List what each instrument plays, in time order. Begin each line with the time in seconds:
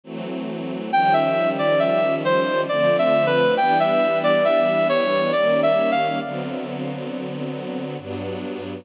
0.04 string ensemble 1 E3 F#3 A3 C4
0.91 string ensemble 1 D#3 F3 G3 C#4, brass section G5
1.13 brass section E5
1.58 brass section D5
1.79 brass section E5
2.25 brass section C5
2.69 string ensemble 1 D3 F3 A3 C4, brass section D5
2.98 brass section E5
3.26 brass section B4
3.57 string ensemble 1 E3 G3 B3 D4, brass section G5
3.80 brass section E5
4.24 brass section D5
4.45 brass section E5
4.89 brass section C#5
5.32 string ensemble 1 D#3 G3 A#3 C#4, brass section D5
5.63 brass section E5
5.91 brass section F5
6.22 string ensemble 1 D3 F#3 B3 C4
7.98 string ensemble 1 G2 F#3 B3 D4